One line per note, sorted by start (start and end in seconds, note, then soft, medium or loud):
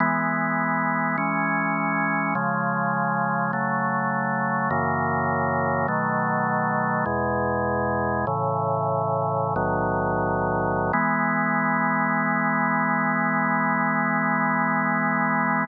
0.00 1.17 E3 medium
0.00 1.17 G#3 medium
0.00 1.17 B3 medium
1.18 2.34 E3 medium
1.18 2.34 G#3 medium
1.18 2.34 C#4 medium
2.35 3.51 C#3 medium
2.35 3.51 F3 medium
2.35 3.51 G#3 medium
3.53 4.70 C#3 medium
3.53 4.70 F#3 medium
3.53 4.70 A3 medium
4.71 5.87 F#2 medium
4.71 5.87 C#3 medium
4.71 5.87 E3 medium
4.71 5.87 A#3 medium
5.88 7.05 B2 medium
5.88 7.05 D#3 medium
5.88 7.05 F#3 medium
5.88 7.05 A3 loud
7.06 8.26 E2 medium
7.06 8.26 B2 medium
7.06 8.26 G#3 medium
8.27 9.55 A2 medium
8.27 9.55 C#3 medium
8.27 9.55 E3 medium
9.56 10.92 B1 medium
9.56 10.92 A2 medium
9.56 10.92 D#3 medium
9.56 10.92 F#3 medium
10.93 15.65 E3 loud
10.93 15.65 G#3 loud
10.93 15.65 B3 loud